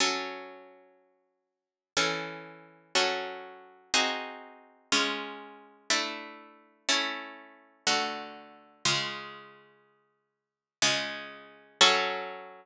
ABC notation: X:1
M:3/4
L:1/8
Q:1/4=61
K:F#m
V:1 name="Acoustic Guitar (steel)"
[F,CA]4 [E,CA]2 | [F,CA]2 [^B,^DFG]2 [G,C^E]2 | [A,DE]2 [A,CE]2 [D,A,F]2 | [C,G,^E]4 [C,G,E]2 |
[F,CA]6 |]